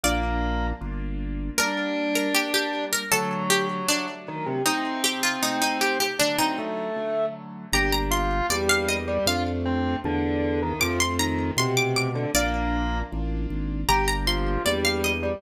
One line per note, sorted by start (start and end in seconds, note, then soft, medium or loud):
0.04 0.73 A#1 loud
0.04 0.66 A#3 medium
0.04 0.73 A#3 loud
0.04 0.73 D4 loud
0.04 0.73 F4 loud
0.04 0.58 D5 loud
0.81 1.51 G1 medium
0.81 1.50 A#3 loud
0.81 1.50 D4 medium
0.81 1.50 F4 loud
1.58 2.27 G3 loud
1.58 2.27 A#3 loud
1.58 2.27 D4 loud
1.58 2.84 D4 medium
1.58 2.09 A#4 loud
2.15 2.33 A#4 medium
2.35 3.04 G3 loud
2.35 3.04 A#3 medium
2.35 3.04 D4 loud
2.35 2.51 G4 medium
2.54 2.90 G4 medium
2.93 3.09 A#4 medium
3.11 3.81 D3 loud
3.11 4.06 F#3 medium
3.11 3.81 F#3 loud
3.11 3.81 A3 loud
3.11 3.43 A4 loud
3.50 3.67 G4 loud
3.88 4.58 D3 medium
3.88 4.58 F#3 loud
3.88 4.58 A3 medium
3.88 4.54 D4 medium
4.28 4.45 D#3 medium
4.46 4.62 C3 medium
4.66 5.35 C3 loud
4.66 5.35 A3 loud
4.66 5.98 C4 medium
4.66 5.35 D#4 loud
4.66 5.02 D#4 medium
5.04 5.20 G4 loud
5.23 5.40 F4 medium
5.42 6.12 C3 medium
5.42 6.12 A3 medium
5.42 6.12 D#4 medium
5.42 5.61 D#4 medium
5.62 5.78 D#4 medium
5.81 5.99 G4 medium
6.00 6.17 G4 medium
6.19 6.89 D3 loud
6.19 6.89 F#3 loud
6.19 6.89 A3 loud
6.19 6.37 D4 medium
6.38 6.57 C4 medium
6.38 7.13 D#4 medium
6.58 7.25 A3 medium
6.96 7.66 D3 medium
6.96 7.66 F#3 medium
6.96 7.66 A3 medium
7.73 8.42 G1 loud
7.73 8.42 A#3 medium
7.73 8.42 D4 loud
7.73 8.42 G4 loud
7.73 7.93 G4 medium
7.73 7.89 A#5 loud
7.92 8.10 A#5 loud
8.11 8.46 F4 medium
8.11 8.43 C6 loud
8.50 9.19 E2 medium
8.50 8.97 G3 medium
8.50 9.19 A#3 medium
8.50 9.19 D4 medium
8.50 9.19 G4 medium
8.50 8.66 D5 medium
8.69 8.88 F5 loud
8.89 9.25 D#5 medium
9.08 9.25 G3 medium
9.26 9.96 F2 loud
9.26 9.96 A3 loud
9.26 9.96 D4 loud
9.26 9.96 F4 loud
9.26 9.43 F4 medium
9.26 10.66 F5 loud
9.65 9.96 C4 medium
10.04 10.73 E2 loud
10.04 10.60 D3 medium
10.04 10.73 A3 medium
10.04 10.73 D4 loud
10.04 10.73 F4 medium
10.62 10.81 D#3 medium
10.80 11.51 F2 loud
10.80 10.99 F3 medium
10.80 11.50 A3 loud
10.80 11.50 C4 loud
10.80 11.50 F4 loud
10.80 10.96 D6 loud
11.00 11.16 C6 loud
11.19 11.51 D#3 medium
11.19 11.52 A#5 loud
11.57 12.26 B2 medium
11.57 12.08 C3 medium
11.57 12.27 A3 loud
11.57 12.27 C4 loud
11.57 12.27 F4 medium
11.57 11.74 C6 loud
11.77 11.93 D6 loud
11.96 12.32 D6 medium
12.15 12.30 D3 medium
12.34 13.03 A#1 loud
12.34 13.04 A#3 loud
12.34 12.98 A#3 medium
12.34 13.04 D4 loud
12.34 13.04 F4 loud
12.34 12.89 D5 loud
13.12 13.47 A1 loud
13.12 13.81 A#3 medium
13.12 13.81 D4 medium
13.12 13.81 F4 medium
13.50 13.85 G#1 medium
13.89 14.58 G1 loud
13.89 14.58 A#3 loud
13.89 14.58 D4 loud
13.89 14.07 G4 medium
13.89 14.58 G4 loud
13.89 14.05 A#5 loud
14.08 14.26 A#5 loud
14.27 14.62 F3 medium
14.27 14.59 C6 medium
14.65 15.35 E2 loud
14.65 15.11 G3 medium
14.65 15.35 A#3 loud
14.65 15.35 D4 medium
14.65 15.35 G4 medium
14.65 14.81 D5 medium
14.85 15.03 F5 loud
15.04 15.41 D#5 medium
15.23 15.41 G3 medium